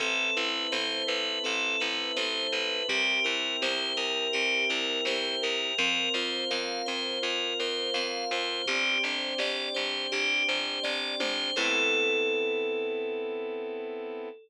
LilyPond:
<<
  \new Staff \with { instrumentName = "Tubular Bells" } { \time 4/4 \key a \minor \tempo 4 = 83 a'8 b'8 c''8 b'8 a'8 b'8 c''8 b'8 | g'8 bes'8 c''8 bes'8 g'8 bes'8 c''8 bes'8 | bes'8 c''8 f''8 c''8 bes'8 c''8 f''8 c''8 | g'8 c''8 d''8 c''8 g'8 c''8 d''8 c''8 |
a'1 | }
  \new Staff \with { instrumentName = "Vibraphone" } { \time 4/4 \key a \minor c'8 e'8 a'8 b'8 c'8 e'8 a'8 b'8 | c'8 e'8 g'8 bes'8 c'8 e'8 g'8 bes'8 | c'8 f'8 bes'8 c'8 f'8 bes'8 c'8 f'8 | c'8 d'8 g'8 c'8 d'8 g'8 c'8 d'8 |
<c' e' a' b'>1 | }
  \new Staff \with { instrumentName = "Electric Bass (finger)" } { \clef bass \time 4/4 \key a \minor a,,8 a,,8 a,,8 a,,8 a,,8 a,,8 a,,8 a,,8 | c,8 c,8 c,8 c,8 c,8 c,8 c,8 c,8 | f,8 f,8 f,8 f,8 f,8 f,8 f,8 f,8 | g,,8 g,,8 g,,8 g,,8 g,,8 g,,8 g,,8 g,,8 |
a,1 | }
  \new Staff \with { instrumentName = "Brass Section" } { \time 4/4 \key a \minor <b' c'' e'' a''>1 | <bes' c'' e'' g''>1 | <bes' c'' f''>1 | <c'' d'' g''>1 |
<b c' e' a'>1 | }
  \new DrumStaff \with { instrumentName = "Drums" } \drummode { \time 4/4 <hh bd>4 sn4 hh4 sn4 | <hh bd>4 sn4 hh4 sn4 | <hh bd>4 sn4 hh4 sn4 | <hh bd>4 sn4 hh4 <bd sn>8 toml8 |
<cymc bd>4 r4 r4 r4 | }
>>